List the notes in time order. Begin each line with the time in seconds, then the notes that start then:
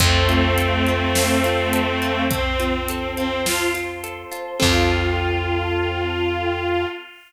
0.00 F2 A3 C4 C5 F5 A5, kick, closed hi-hat
0.29 F4, closed hi-hat
0.58 A4, closed hi-hat
0.87 F4, closed hi-hat
1.15 C4, snare
1.44 F4, closed hi-hat
1.73 A4, closed hi-hat
2.02 F4, closed hi-hat
2.30 C4 C5 A5 C6, kick, closed hi-hat
2.59 C4 F4, closed hi-hat
2.88 A4, closed hi-hat
3.16 C4 F4, closed hi-hat
3.45 C4 F4, snare
3.74 F4, closed hi-hat
4.04 A4, closed hi-hat
4.31 F4, closed hi-hat
4.60 F2 C4 F4 A4, kick, crash